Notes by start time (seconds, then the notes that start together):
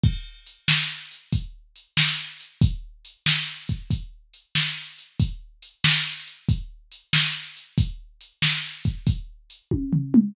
0.03 kick, crash
0.47 closed hi-hat
0.68 snare
1.11 closed hi-hat
1.32 kick, closed hi-hat
1.76 closed hi-hat
1.97 snare
2.40 closed hi-hat
2.61 kick, closed hi-hat
3.05 closed hi-hat
3.26 snare
3.69 kick, closed hi-hat
3.90 kick, closed hi-hat
4.34 closed hi-hat
4.55 snare
4.98 closed hi-hat
5.20 kick, closed hi-hat
5.62 closed hi-hat
5.84 snare
6.27 closed hi-hat
6.49 kick, closed hi-hat
6.92 closed hi-hat
7.13 snare
7.56 closed hi-hat
7.78 kick, closed hi-hat
8.21 closed hi-hat
8.42 snare
8.85 kick, closed hi-hat
9.07 kick, closed hi-hat
9.50 closed hi-hat
9.71 kick, high tom
9.93 floor tom
10.14 mid tom